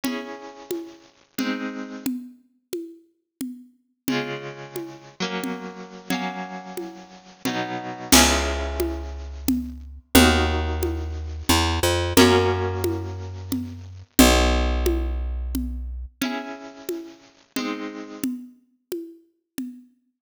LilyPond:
<<
  \new Staff \with { instrumentName = "Orchestral Harp" } { \time 9/8 \key cis \dorian \tempo 4. = 89 <cis' e' gis'>2. <gis bis dis'>4. | r1 r8 | <cis gis eis'>2~ <cis gis eis'>8 <fis ais cis'>2 | <fis ais cis'>2. <b, fis dis'>4. |
<cis' e' gis'>1~ <cis' e' gis'>8 | <dis' fis' ais'>1~ <dis' fis' ais'>8 | <ais cis' fis'>1~ <ais cis' fis'>8 | r1 r8 |
<cis' e' gis'>2. <gis bis dis'>4. | r1 r8 | }
  \new Staff \with { instrumentName = "Electric Bass (finger)" } { \clef bass \time 9/8 \key cis \dorian r1 r8 | r1 r8 | r1 r8 | r1 r8 |
cis,1~ cis,8 | dis,2. e,8. f,8. | fis,1~ fis,8 | b,,1~ b,,8 |
r1 r8 | r1 r8 | }
  \new DrumStaff \with { instrumentName = "Drums" } \drummode { \time 9/8 cgl4. cgho4. cgl4. | cgl4. cgho4. cgl4. | cgl4. cgho4. cgl4. | cgl4. cgho4. cgl4. |
<cgl cymc>4. cgho4. cgl4. | cgl4. cgho4. cgl4. | cgl4. cgho4. cgl4. | cgl4. cgho4. cgl4. |
cgl4. cgho4. cgl4. | cgl4. cgho4. cgl4. | }
>>